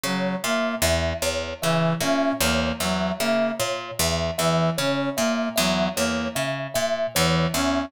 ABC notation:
X:1
M:5/4
L:1/8
Q:1/4=76
K:none
V:1 name="Pizzicato Strings" clef=bass
^C, ^A,, E,, E,, C, A,, E,, E,, C, A,, | E,, E,, ^C, ^A,, E,, E,, C, A,, E,, E,, |]
V:2 name="Brass Section"
^F, ^A, z2 E, ^C A, F, A, z | z E, ^C ^A, ^F, A, z2 E, C |]
V:3 name="Kalimba"
^c e e c e e c e e c | e e ^c e e c e e c e |]